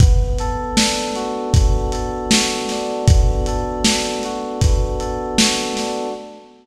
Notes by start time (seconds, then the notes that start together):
0.00 B3, kick, closed hi-hat
0.38 A4, closed hi-hat
0.76 D4, snare
1.15 F#4, closed hi-hat
1.54 B3, kick, closed hi-hat
1.92 A4, closed hi-hat
2.31 F#4, snare
2.69 D4, snare, closed hi-hat
3.08 B3, kick, closed hi-hat
3.46 A4, closed hi-hat
3.84 D4, snare
4.23 F#4, closed hi-hat
4.61 B3, kick, closed hi-hat
4.99 A4, closed hi-hat
5.38 F#4, snare
5.77 D4, snare, closed hi-hat